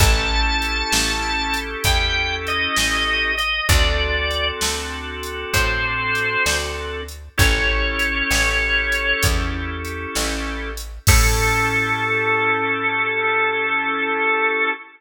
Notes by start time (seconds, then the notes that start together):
0.00 A1 C#4 E4 G4 A4 A5, kick, closed hi-hat
0.62 closed hi-hat
0.92 A1, snare
1.54 closed hi-hat
1.84 E2 G5, kick, closed hi-hat
2.47 D#5, closed hi-hat
2.76 A1, snare
3.38 D#5, closed hi-hat
3.69 D2 C4 D4 F#4 A4 D5, kick, closed hi-hat
4.31 closed hi-hat
4.61 D2, snare
5.23 closed hi-hat
5.53 A2 C5, kick, closed hi-hat
6.15 closed hi-hat
6.46 D2, snare
7.08 closed hi-hat
7.38 A1 C#4 E4 G4 A4 C#5, kick, closed hi-hat
7.99 closed hi-hat
8.31 A1, snare
8.92 closed hi-hat
9.23 E2, kick, closed hi-hat
9.85 closed hi-hat
10.15 A1, snare
10.77 closed hi-hat
11.07 A2 C#4 E4 G4 A4, kick, crash